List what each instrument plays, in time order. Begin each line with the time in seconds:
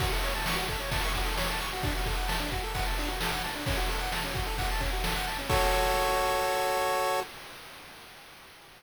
0.00 lead 1 (square) F#4, kick, ride
0.13 lead 1 (square) A4
0.23 lead 1 (square) C#5, ride
0.35 lead 1 (square) A5
0.46 lead 1 (square) C#6, snare
0.56 lead 1 (square) F#4
0.69 lead 1 (square) A4, kick, ride
0.80 lead 1 (square) C#5
0.91 lead 1 (square) A5, kick, ride
1.03 lead 1 (square) C#6
1.14 lead 1 (square) F#4, kick, ride
1.25 lead 1 (square) A4
1.37 lead 1 (square) C#5, snare
1.49 lead 1 (square) A5
1.60 lead 1 (square) C#6, ride
1.73 lead 1 (square) F#4
1.83 lead 1 (square) D4, kick, ride
1.95 lead 1 (square) F#4
2.06 lead 1 (square) A4, kick, ride
2.17 lead 1 (square) F#5
2.28 lead 1 (square) A5, snare
2.40 lead 1 (square) D4
2.51 lead 1 (square) F#4, kick, ride
2.63 lead 1 (square) A4
2.74 lead 1 (square) F#5, kick, ride
2.86 lead 1 (square) A5
2.98 lead 1 (square) D4, ride
3.08 lead 1 (square) F#4
3.21 lead 1 (square) A4, snare
3.32 lead 1 (square) F#5
3.43 lead 1 (square) A5, ride
3.55 lead 1 (square) D4
3.66 lead 1 (square) C#4, kick, ride
3.77 lead 1 (square) F#4
3.89 lead 1 (square) A4, ride
4.00 lead 1 (square) F#5
4.12 lead 1 (square) A5, snare
4.24 lead 1 (square) C#4
4.34 lead 1 (square) F#4, kick, ride
4.47 lead 1 (square) A4
4.58 lead 1 (square) F#5, kick, ride
4.71 lead 1 (square) A5
4.80 lead 1 (square) C#4, kick, ride
4.93 lead 1 (square) F#4
5.04 lead 1 (square) A4, snare
5.16 lead 1 (square) F#5
5.27 lead 1 (square) A5, ride
5.38 lead 1 (square) C#4
5.49 lead 1 (square) F#4 A4 C#5, kick, crash